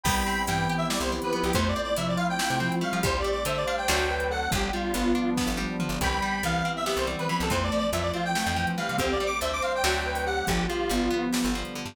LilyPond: <<
  \new Staff \with { instrumentName = "Lead 1 (square)" } { \time 7/8 \key c \major \tempo 4 = 141 <g'' b''>4 g''8. e''16 d''16 c''16 r16 b'16 b'16 g'16 | \tuplet 3/2 { c''8 d''8 d''8 } e''16 d''16 f''16 g''4~ g''16 f''8 | \tuplet 3/2 { c''8 d''8 d''8 } e''16 d''16 f''16 g''4~ g''16 fis''8 | g'8 f'4. r4. |
<g'' b''>4 f''8. e''16 e''16 c''16 r16 b'16 b''16 a'16 | \tuplet 3/2 { c''8 d''8 d''8 } e''16 d''16 f'16 g''4~ g''16 f''8 | \tuplet 3/2 { c'8 d''8 d'''8 } e''16 d'''16 f''16 g''4~ g''16 fis''8 | g'8 f'4. r4. | }
  \new Staff \with { instrumentName = "Ocarina" } { \time 7/8 \key c \major g4 e4 g8 e16 e16 f8 | a4 f4 a8 f16 f16 g8 | g'4 c''4 fis'8 b'16 b'16 a'8 | g8 g8 b4. r4 |
g4 e4 g'8 e16 e16 f8 | a4 f4 a8 f16 f16 g8 | g'4 c''4 fis'8 b'16 b'16 g'8 | f8 g'8 b4. r4 | }
  \new Staff \with { instrumentName = "Acoustic Guitar (steel)" } { \time 7/8 \key c \major b8 c'8 e'8 g'8 e'8 c'8 b8 | a8 c'8 e'8 f'8 e'8 c'8 a8 | g8 a8 c'8 d'8 <fis a c' d'>4. | f8 g8 b8 d'8 b8 g8 f8 |
e8 g8 b8 c'8 b8 g8 e8 | e8 f8 a8 c'8 a8 f8 e8 | d8 g8 a8 c'8 <d fis a c'>4. | d8 f8 g8 b8 g8 f8 d8 | }
  \new Staff \with { instrumentName = "Electric Bass (finger)" } { \clef bass \time 7/8 \key c \major c,4 g,4~ g,16 c,4 c,16 | f,4 c4~ c16 c4 f16 | d,4 d4 d,4. | g,,4 g,,4~ g,,16 g,,4 g,,16 |
c,4 c,4~ c,16 c,4 c,16 | f,4 f,4~ f,16 f,4 c16 | d,4 d,4 d,4. | g,,4 g,,4~ g,,16 g,,4 g,16 | }
  \new Staff \with { instrumentName = "Pad 2 (warm)" } { \time 7/8 \key c \major <b c' e' g'>2.~ <b c' e' g'>8 | <a c' e' f'>2.~ <a c' e' f'>8 | <g a c' d'>4 <g a d' g'>4 <fis a c' d'>4. | <f g b d'>2.~ <f g b d'>8 |
<e g b c'>2.~ <e g b c'>8 | <e f a c'>2.~ <e f a c'>8 | <d g a c'>4 <d g c' d'>4 <d fis a c'>4. | <d f g b>2.~ <d f g b>8 | }
  \new DrumStaff \with { instrumentName = "Drums" } \drummode { \time 7/8 <cymc bd>4 hh4 sn8. hh8. | <hh bd>4 hh4 sn8. hh8. | <hh bd>4 hh4 sn8. hh8. | <hh bd>4 hh4 <bd sn>8 tommh8 toml8 |
<hh bd>4 hh4 sn8. hh8. | <hh bd>4 hh4 sn8. hh8. | <hh bd>4 hh4 sn8. hho8. | <hh bd>4 hh4 sn8. hh8. | }
>>